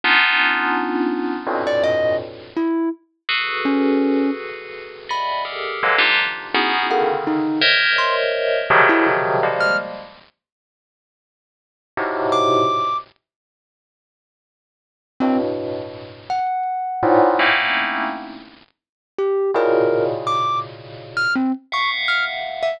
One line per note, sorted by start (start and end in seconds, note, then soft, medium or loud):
0.04 1.34 B3 loud
0.04 1.34 C#4 loud
0.04 1.34 D4 loud
0.04 1.34 D#4 loud
0.04 1.34 F4 loud
1.47 2.12 F2 medium
1.47 2.12 G2 medium
1.47 2.12 A2 medium
1.47 2.12 A#2 medium
1.47 2.12 B2 medium
1.67 1.83 D5 loud
1.83 2.16 D#5 loud
2.56 2.89 E4 medium
3.29 4.91 F#4 medium
3.29 4.91 G#4 medium
3.29 4.91 A4 medium
3.29 4.91 B4 medium
3.65 4.30 C#4 medium
5.09 5.42 D5 medium
5.09 5.42 D#5 medium
5.09 5.42 E5 medium
5.09 5.42 F#5 medium
5.09 5.42 G#5 medium
5.09 5.43 B5 medium
5.45 5.77 G4 medium
5.45 5.77 G#4 medium
5.45 5.77 A4 medium
5.45 5.77 A#4 medium
5.83 5.99 D3 medium
5.83 5.99 E3 medium
5.83 5.99 F#3 medium
5.83 5.99 G#3 medium
5.83 5.99 A#3 medium
5.98 6.15 D4 loud
5.98 6.15 D#4 loud
5.98 6.15 F4 loud
5.98 6.15 G4 loud
6.54 6.87 B3 loud
6.54 6.87 C#4 loud
6.54 6.87 D#4 loud
6.54 6.87 E4 loud
6.54 6.87 F#4 loud
6.54 6.87 G#4 loud
6.91 7.56 C#3 medium
6.91 7.56 D3 medium
6.91 7.56 D#3 medium
6.91 7.07 F#5 medium
7.27 7.59 D#4 medium
7.61 8.59 A#4 loud
7.61 8.59 C5 loud
7.61 8.59 C#5 loud
7.61 8.59 D#5 loud
7.61 8.59 E5 loud
7.98 8.15 C6 medium
8.70 9.35 B2 loud
8.70 9.35 C3 loud
8.70 9.35 C#3 loud
8.70 9.35 D#3 loud
8.70 9.35 F3 loud
8.70 9.35 F#3 loud
8.89 9.05 E4 medium
9.43 9.76 F3 medium
9.43 9.76 G3 medium
9.43 9.76 G#3 medium
9.43 9.76 A#3 medium
9.60 9.77 F6 medium
11.97 12.62 G#2 medium
11.97 12.62 A2 medium
11.97 12.62 B2 medium
11.97 12.62 C3 medium
12.32 12.97 D6 loud
15.20 16.19 G2 medium
15.20 16.19 A2 medium
15.20 16.19 B2 medium
15.20 15.37 C4 loud
16.30 18.25 F#5 medium
17.03 17.35 G#2 loud
17.03 17.35 A2 loud
17.03 17.35 A#2 loud
17.39 18.04 A3 medium
17.39 18.04 A#3 medium
17.39 18.04 C4 medium
17.39 18.04 C#4 medium
17.39 18.04 D#4 medium
17.39 18.04 E4 medium
19.18 19.51 G4 medium
19.54 21.17 A2 medium
19.54 21.17 A#2 medium
19.54 21.17 B2 medium
19.54 21.17 C#3 medium
19.54 20.05 A#4 medium
20.27 20.59 D6 medium
21.17 21.33 F6 loud
21.36 21.52 C4 medium
21.72 22.70 E5 medium
21.72 22.70 F5 medium
21.72 22.70 F#5 medium
21.72 21.90 C#6 medium
22.08 22.24 F6 medium
22.63 22.79 E5 loud